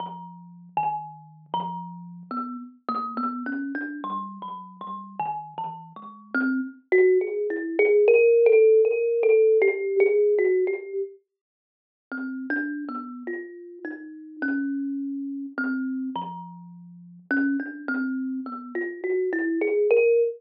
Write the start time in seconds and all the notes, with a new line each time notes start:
0.00 F3
0.77 D#3
1.54 F3
2.31 B3
2.88 A#3
3.17 B3
3.46 C#4
3.75 D4
4.04 G3
4.42 F#3
4.81 G3
5.19 D#3
5.58 E3
5.96 G#3
6.35 C4
6.92 F#4
7.21 G#4
7.50 E4
7.79 G#4
8.08 A#4
8.46 A4
8.85 A#4
9.23 A4
9.62 G4
10.00 G#4
10.38 F#4
10.67 G4
12.12 C4
12.50 D4
12.89 B3
13.27 F4
13.85 D#4
14.42 C#4
15.58 C4
16.16 F3
17.31 C#4
17.60 D4
17.88 C4
18.46 B3
18.75 F4
19.04 F#4
19.33 E4
19.62 G#4
19.91 A#4